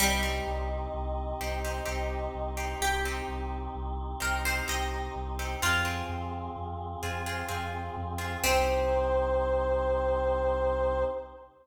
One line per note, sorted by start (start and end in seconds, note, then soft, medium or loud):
0.00 0.40 C2 loud
0.00 2.25 G3 loud
0.00 0.18 C4 loud
0.00 5.57 C4 medium
0.00 0.18 D#4 medium
0.00 5.57 D#4 medium
0.00 0.18 G4 medium
0.00 5.57 G4 medium
0.00 2.55 D#5 medium
0.23 0.98 C4 medium
0.23 0.98 D#4 medium
0.23 0.98 G4 medium
0.47 0.87 C2 loud
0.94 1.34 C2 medium
1.41 1.80 C2 medium
1.41 1.60 C4 medium
1.41 1.60 D#4 medium
1.41 1.60 G4 medium
1.64 1.83 C4 medium
1.64 1.83 D#4 medium
1.64 1.83 G4 medium
1.86 2.28 C2 medium
1.86 2.42 C4 medium
1.86 2.42 D#4 medium
1.86 2.42 G4 medium
2.35 2.74 C2 medium
2.57 2.95 C4 medium
2.57 2.95 D#4 medium
2.57 2.95 G4 medium
2.81 3.21 C2 medium
2.81 4.00 G4 medium
3.05 3.80 C4 medium
3.05 3.80 D#4 medium
3.05 3.80 G4 medium
3.28 3.68 C2 medium
3.75 4.15 C2 medium
4.20 4.62 C2 loud
4.20 4.39 C4 medium
4.20 4.39 D#4 medium
4.20 4.39 G4 medium
4.20 4.44 A#4 medium
4.45 4.65 C4 medium
4.45 4.65 D#4 medium
4.45 4.65 G4 medium
4.45 4.68 C5 medium
4.68 5.09 C2 medium
4.68 5.24 C4 medium
4.68 5.24 D#4 medium
4.68 5.24 G4 medium
4.68 5.48 D#5 medium
5.16 5.55 C2 medium
5.39 5.58 C4 medium
5.39 5.58 D#4 medium
5.39 5.58 G4 medium
5.62 6.02 F2 loud
5.62 5.81 C4 medium
5.62 8.42 C4 medium
5.62 5.81 F4 medium
5.62 6.40 F4 medium
5.62 8.42 F4 medium
5.62 5.81 G#4 medium
5.62 8.42 G#4 medium
5.85 6.60 C4 medium
5.85 6.60 F4 medium
5.85 6.60 G#4 medium
6.09 6.49 F2 medium
6.56 6.96 F2 medium
7.03 7.43 F2 medium
7.03 7.21 C4 medium
7.03 7.21 F4 medium
7.03 7.21 G#4 medium
7.26 7.45 C4 medium
7.26 7.45 F4 medium
7.26 7.45 G#4 medium
7.48 7.90 F2 loud
7.48 8.05 C4 medium
7.48 8.05 F4 medium
7.48 8.05 G#4 medium
7.97 8.37 F2 loud
8.18 8.37 C4 medium
8.18 8.37 F4 medium
8.18 8.37 G#4 medium
8.44 11.04 C2 loud
8.44 11.04 C4 loud
8.44 11.05 C4 loud
8.44 11.04 D#4 loud
8.44 11.05 D#4 loud
8.44 11.04 G4 loud
8.44 11.05 G4 loud
8.44 11.04 C5 loud